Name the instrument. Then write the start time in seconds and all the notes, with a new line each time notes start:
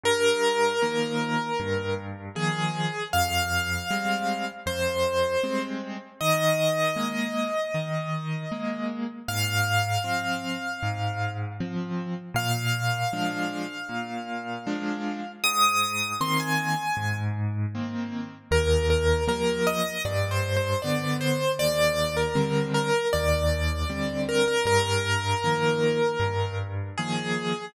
acoustic grand piano
0.04 G2 A#4
0.82 D#3 F3 A#3
1.60 G2
2.35 D#3 F3 A#3 G#4
3.13 F2 F5
3.90 G3 G#3 C4
4.66 F2 C5
5.44 G3 G#3 C4
6.21 D#3 D#5
6.96 G#3 A#3
7.74 D#3
8.52 G#3 A#3
9.28 G#2 F5
10.04 F3 C4
10.83 G#2
11.60 F3 C4
12.34 A#2 F5
13.13 F3 G#3 D4
13.89 A#2
14.67 F3 G#3 D4
15.44 G#2 D#6
16.21 D#3 A#3 C4 C6
16.40 G#5
16.97 G#2
17.75 D#3 A#3 C4
18.51 D#2 A#4
18.90 A#4
19.28 F3 G3 A#3 A#4
19.67 D#5
20.05 G2 D5
20.31 C5
20.57 C5
20.82 D3 B3 D5
21.21 C5
21.59 D#2 D5
22.17 A#4
22.35 D3 G3 C4
22.74 A#4
23.13 D#2 D5
23.90 D3 G3 C4
24.29 A#4
24.48 A#4
24.65 G2 A#4
25.44 D#3 F3 A#3
26.20 G2
26.98 D#3 F3 A#3 G#4